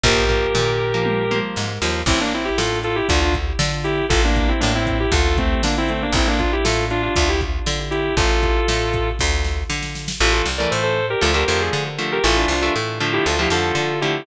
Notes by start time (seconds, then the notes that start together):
0.03 A#1 F3 A#3 G4 A#4, kick, floor tom
0.29 F3 A#3, floor tom
0.55 A#2, mid tom
0.94 F3 A#3
1.05 high tom
1.31 F3 A#3, high tom
1.56 G#2, snare
1.82 D#2 F3 A#3, snare
2.06 A1 C4 E4, kick, crash
2.20 A#3 D4
2.32 C4 E4, closed hi-hat
2.45 E4 G4
2.57 A2 F4 A4, snare
2.83 F4 A4, closed hi-hat
2.95 E4 G4
3.08 D2 D4 F4, kick, closed hi-hat
3.21 D4 F4
3.34 kick, closed hi-hat
3.59 D3, snare
3.84 E4 G4, closed hi-hat
4.09 A1 F4 A4, kick, closed hi-hat
4.24 A#3 D4
4.36 kick, closed hi-hat
4.48 C4 E4
4.60 A2 A#3 D4, snare
4.75 C4 E4
4.87 kick, closed hi-hat
5.00 E4 G4
5.12 D2 F4 A4, kick, closed hi-hat
5.38 A3 C4, kick, closed hi-hat
5.63 D3 A#3 D4, snare
5.78 C4 E4
5.88 A3 C4, closed hi-hat
6.02 A#3 D4
6.13 A1 C4 E4, kick, closed hi-hat
6.27 A#3 D4
6.39 D4 F4, kick, closed hi-hat
6.52 E4 G4
6.64 A2 F4 A4, snare
6.90 D4 F4, closed hi-hat
7.02 D4 F4
7.16 D2 D4 F4, kick, closed hi-hat
7.28 E4 G4
7.41 kick, closed hi-hat
7.66 D3, snare
7.91 E4 G4, closed hi-hat
8.17 A1 F4 A4, kick, closed hi-hat
8.43 kick, closed hi-hat
8.68 A2, snare
8.93 kick, closed hi-hat
9.19 D2, kick, snare
9.44 snare
9.70 D3, snare
9.82 snare
9.95 snare
10.08 snare
10.20 A1 E3 A3 F4 A4
10.33 F4 A4
10.45 C2
10.58 E3 A3 A#4 D5
10.71 A2 A4 C5
10.83 A4 C5
11.10 G4 A#4
11.21 D2 D3 F3 A3 F4 A4
11.34 D3 F3 A3 G4 A#4
11.48 F2 D3 F3 A3 G4 A#4
11.61 G#4
11.73 D3
11.98 D3 F3 A3
12.12 G4 A#4
12.24 A1 E3 A3 F4 A4
12.36 D4 F4
12.48 C2 D4 F4
12.61 E3 A3 D4 F4
12.76 A2
13.00 D3 F3 A3
13.13 E4 G4
13.26 D2 F4 A4
13.39 D3 F3 A3 E4 G4
13.50 F2 D3 F3 A3 F4 A4
13.75 D3
14.01 D3 F3 A3 E4 G4